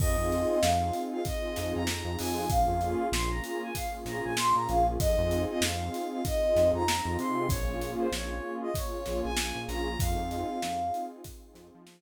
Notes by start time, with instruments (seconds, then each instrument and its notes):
0.00 synth bass 1 F2, pad 2 (warm) C4 D#4 F4 G#4, ocarina D#5, kick, crash
0.18 synth bass 1 F2
0.32 closed hi-hat
0.50 ocarina D#5
0.61 synth bass 1 F2, pad 2 (warm) C4 D#4 F4 G#4, ocarina F5, snare
0.93 closed hi-hat
1.12 ocarina F5
1.25 pad 2 (warm) C4 D#4 F4 G#4, ocarina D#5, kick, closed hi-hat
1.56 synth bass 1 F2, snare, closed hi-hat
1.75 synth bass 1 F2, ocarina A#5
1.87 pad 2 (warm) C4 D#4 F4 G#4, snare
2.05 synth bass 1 F2
2.19 synth bass 1 F2, ocarina G#5, open hi-hat
2.50 synth bass 1 A#1, pad 2 (warm) A#3 C#4 F4 G#4, ocarina F5, kick, closed hi-hat
2.68 synth bass 1 F2
2.81 closed hi-hat
3.12 synth bass 1 A#1, pad 2 (warm) A#3 C#4 F4 G#4, ocarina C6, snare
3.30 ocarina A#5
3.44 ocarina A#5, closed hi-hat
3.62 ocarina G#5
3.75 pad 2 (warm) A#3 C#4 F4 G#4, ocarina F5, kick, closed hi-hat
4.05 synth bass 1 A#1, ocarina A#5, snare, closed hi-hat
4.24 synth bass 1 A#1, ocarina G#5
4.37 pad 2 (warm) A#3 C#4 F4 G#4, ocarina C6, snare
4.55 synth bass 1 A#2, ocarina A#5
4.69 synth bass 1 A#1, ocarina F5, closed hi-hat
5.00 synth bass 1 F2, pad 2 (warm) C4 D#4 F4 G#4, ocarina D#5, kick, closed hi-hat
5.18 synth bass 1 F2
5.31 closed hi-hat
5.49 ocarina D#5
5.61 synth bass 1 F2, pad 2 (warm) C4 D#4 F4 G#4, ocarina F5, snare
5.94 closed hi-hat
6.11 ocarina F5
6.25 pad 2 (warm) C4 D#4 F4 G#4, ocarina D#5, kick, closed hi-hat
6.56 synth bass 1 F2, snare, closed hi-hat
6.73 synth bass 1 F2, ocarina A#5
6.88 pad 2 (warm) C4 D#4 F4 G#4, snare
7.05 synth bass 1 F2
7.19 synth bass 1 C3, ocarina C6, closed hi-hat
7.49 synth bass 1 A#1, pad 2 (warm) A#3 C#4 F4 G#4, ocarina C#5, kick, closed hi-hat
7.68 synth bass 1 A#1
7.81 closed hi-hat
7.99 ocarina C5
8.12 synth bass 1 A#1, pad 2 (warm) A#3 C#4 F4 G#4, ocarina C#5, snare
8.62 ocarina D#5
8.74 pad 2 (warm) A#3 C#4 F4 G#4, ocarina C#5, kick, closed hi-hat
9.06 synth bass 1 A#1, snare, closed hi-hat
9.23 synth bass 1 A#1, ocarina G#5
9.37 pad 2 (warm) A#3 C#4 F4 G#4, snare
9.55 synth bass 1 A#1
9.67 synth bass 1 A#1, ocarina A#5, snare, closed hi-hat
9.99 synth bass 1 F2, pad 2 (warm) C4 D#4 F4 G#4, ocarina F5, kick, closed hi-hat
10.17 synth bass 1 F2
10.31 closed hi-hat
10.62 synth bass 1 F2, pad 2 (warm) C4 D#4 F4 G#4, snare
10.94 closed hi-hat
11.24 pad 2 (warm) C4 D#4 F4 G#4, kick, closed hi-hat
11.55 synth bass 1 F2, snare, closed hi-hat
11.75 synth bass 1 F3
11.87 pad 2 (warm) C4 D#4 F4 G#4, snare